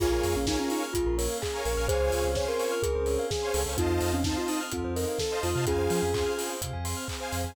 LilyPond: <<
  \new Staff \with { instrumentName = "Ocarina" } { \time 4/4 \key bes \dorian \tempo 4 = 127 f'16 f'8 des'16 ees'16 des'16 ees'16 r16 f'8 bes'8 aes'8 bes'8 | aes'4 des''16 bes'4.~ bes'16 aes'8. r16 | f'16 f'8 des'16 ees'16 f'16 ees'16 r16 f'8 bes'8 a'8 f'8 | aes'4. r2 r8 | }
  \new Staff \with { instrumentName = "Glockenspiel" } { \time 4/4 \key bes \dorian <f' aes'>2 f'8. r4 r16 | <aes' c''>2 aes'8. r4 r16 | <c' ees'>2 c'8. r4 r16 | <des' f'>2 r2 | }
  \new Staff \with { instrumentName = "Lead 2 (sawtooth)" } { \time 4/4 \key bes \dorian <bes' des'' f'' aes''>4 <bes' des'' f'' aes''>2~ <bes' des'' f'' aes''>16 <bes' des'' f'' aes''>8 <bes' des'' f'' aes''>16 | <c'' des'' f'' aes''>4 <c'' des'' f'' aes''>2~ <c'' des'' f'' aes''>16 <c'' des'' f'' aes''>8 <c'' des'' f'' aes''>16 | <c'' ees'' f'' a''>4 <c'' ees'' f'' a''>2~ <c'' ees'' f'' a''>16 <c'' ees'' f'' a''>8 <c'' ees'' f'' a''>16 | <c'' f'' aes''>4 <c'' f'' aes''>2~ <c'' f'' aes''>16 <c'' f'' aes''>8 <c'' f'' aes''>16 | }
  \new Staff \with { instrumentName = "Tubular Bells" } { \time 4/4 \key bes \dorian aes'16 bes'16 des''16 f''16 aes''16 bes''16 des'''16 f'''16 aes'16 bes'16 des''16 f''16 aes''16 bes''16 des'''16 f'''16 | aes'16 c''16 des''16 f''16 aes''16 c'''16 des'''16 f'''16 aes'16 c''16 des''16 f''16 aes''16 c'''16 a'8~ | a'16 c''16 ees''16 f''16 a''16 c'''16 ees'''16 f'''16 a'16 c''16 ees''16 f''16 a''16 c'''16 ees'''16 f'''16 | aes'16 c''16 f''16 aes''16 c'''16 f'''16 aes'16 c''16 f''16 aes''16 c'''16 f'''16 aes'16 c''16 f''16 aes''16 | }
  \new Staff \with { instrumentName = "Synth Bass 2" } { \clef bass \time 4/4 \key bes \dorian bes,,8 f,16 bes,,4~ bes,,16 bes,,16 bes,,4~ bes,,16 bes,,16 bes,,16 | des,8 des,16 des,4~ des,16 des,16 des,4~ des,16 des,16 des,16 | f,8 f,16 f,4~ f,16 f,16 f,4~ f,16 f,16 c16 | f,8 f16 f,4~ f,16 c16 f,4~ f,16 f,16 f,16 | }
  \new Staff \with { instrumentName = "Pad 2 (warm)" } { \time 4/4 \key bes \dorian <bes des' f' aes'>2 <bes des' aes' bes'>2 | <c' des' f' aes'>2 <c' des' aes' c''>2 | <c' ees' f' a'>2 <c' ees' a' c''>2 | <c' f' aes'>2 <c' aes' c''>2 | }
  \new DrumStaff \with { instrumentName = "Drums" } \drummode { \time 4/4 <cymc bd>8 hho8 <bd sn>8 hho8 <hh bd>8 hho8 <hc bd>8 hho8 | <hh bd>8 hho8 <bd sn>8 hho8 <hh bd>8 hho8 <bd sn>8 hho8 | <hh bd>8 hho8 <bd sn>8 hho8 <hh bd>8 hho8 <bd sn>8 hho8 | <hh bd>8 hho8 <hc bd>8 hho8 <hh bd>8 hho8 <hc bd>8 hho8 | }
>>